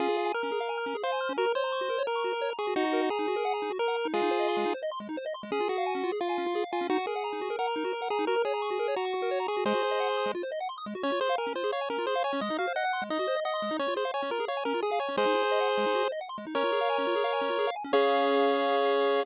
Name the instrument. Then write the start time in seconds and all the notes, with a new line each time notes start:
lead 1 (square)
0.00 C#4 F4 G#4
0.09 G#4
0.17 F5
0.26 G#5
0.34 A#4 F6
0.43 C#4
0.52 G#4
0.60 F5
0.69 G#5
0.78 F6
0.86 C#4
0.95 G#4
1.03 C5 F5
1.12 G#5
1.21 F6
1.29 C#4
1.38 F#4 A#4
1.46 A#4
1.55 C5 C#5
1.64 A#5
1.72 C#6
1.81 F#4
1.90 A#4
1.98 C#5
2.07 A#4 A#5
2.16 C#6
2.24 F#4
2.33 A#4
2.42 C#5
2.50 A#5
2.59 G#4 C#6
2.67 F#4
2.76 D#4 F#4
2.84 F#4
2.93 A#4
3.02 F#5
3.10 G#4 A#5
3.19 D#4
3.28 F#4
3.36 A#4
3.45 F#5
3.54 A#5
3.62 D#4
3.70 F#4
3.79 A#4
3.88 F#5
3.97 A#5
4.05 D#4
4.14 G#3 F4 G#4
4.22 D#4
4.31 C5
4.40 D#5
4.48 C6
4.57 G#3
4.66 D#4
4.74 C5
4.83 D#5
4.92 C6
5.00 G#3
5.09 D#4
5.17 C5
5.26 D#5
5.34 C6
5.43 G#3
5.52 C#4 G#4
5.60 F4
5.69 F#4 G#4
5.78 F5
5.86 G#5
5.95 C#4
6.04 F4
6.12 G#4
6.21 F4 F5
6.29 G#5
6.38 C#4
6.46 F4
6.55 G#4
6.64 F5
6.72 F4 G#5
6.81 C#4
6.90 D#4 F#4
6.98 F#4
7.07 G#4 A#4
7.16 F#5
7.24 A#5
7.33 D#4
7.41 F#4
7.50 A#4
7.59 A#4 F#5
7.67 A#5
7.76 D#4
7.84 F#4
7.93 A#4
8.02 F#5
8.10 G#4 A#5
8.19 D#4
8.27 F#4 A#4
8.36 A#4
8.45 G#4 C#5
8.54 A#5
8.62 C#6
8.71 F#4
8.79 A#4
8.88 C#5
8.96 F#4 A#5
9.05 C#6
9.14 F#4
9.22 A#4
9.31 C#5
9.40 A#5
9.48 G#4 C#6
9.57 F#4
9.65 G#3 G#4 C5
9.74 F#4
9.83 C5
9.91 D#5
10.00 F#5
10.09 C6
10.17 D#6
10.26 G#3
10.35 F4
10.43 C5
10.52 D#5
10.60 F#5
10.69 C6
10.78 D#6
10.86 G#3
10.95 F#4
11.03 C#4 C#5
11.12 F4
11.21 G#4 C5
11.29 F5
11.38 A#4 G#5
11.47 C#4
11.55 F4 C5
11.64 G#4
11.72 C#5 F5
11.81 G#5
11.90 C#4 A#4
11.98 F4
12.07 G#4 C5
12.15 F5
12.24 C#5 G#5
12.33 C#4
12.41 G#3 D#5
12.50 D#4
12.58 F#4 F5
12.67 C5
12.76 D#5 F#5
12.84 F#5
12.93 C6
13.02 G#3
13.10 D#4 D#5
13.19 F#4
13.28 C5
13.36 D#5
13.45 D#5 F#5
13.54 C6
13.62 G#3
13.71 D#4
13.79 C#4 C#5
13.88 F4
13.96 G#4 C5
14.05 F5
14.14 C#5 G#5
14.22 C#4
14.31 F4 A#4
14.40 G#4
14.48 C#5 F5
14.57 G#5
14.65 C#4 A#4
14.74 F4
14.82 G#4
14.91 F5
15.00 C#5 G#5
15.09 C#4
15.17 G#3 G#4 C5
15.26 D#4
15.35 E4
15.43 C5
15.52 D#5
15.60 F#5
15.69 C6
15.78 G#3
15.86 D#4
15.95 F#4
16.03 C5
16.12 D#5
16.21 F#5
16.29 C6
16.38 G#3
16.47 D#4
16.55 C#4 A#4 C#5
16.64 F4
16.72 G#4
16.81 F5
16.90 G#5
16.98 C#4
17.07 F4
17.16 G#4
17.24 F5
17.33 G#5
17.41 C#4
17.50 F4
17.59 G#4
17.67 F5
17.76 G#5
17.84 C#4
17.93 C#4 G#4 C#5 F5